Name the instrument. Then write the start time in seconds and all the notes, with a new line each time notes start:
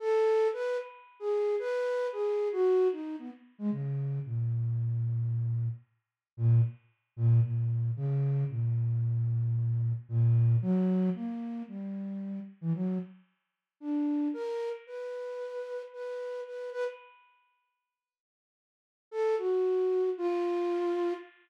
flute
0.00 A4
0.53 B4
1.20 G#4
1.59 B4
2.12 G#4
2.52 F#4
2.92 D#4
3.19 B3
3.59 G#3
3.72 C#3
4.25 A#2
6.37 A#2
7.16 A#2
7.43 A#2
7.96 C#3
8.49 A#2
10.09 A#2
10.62 F#3
11.15 A#3
11.68 G3
12.61 E3
12.75 F#3
13.80 D4
14.34 A#4
14.87 B4
15.93 B4
16.46 B4
16.72 B4
19.11 A4
19.38 F#4
20.18 F4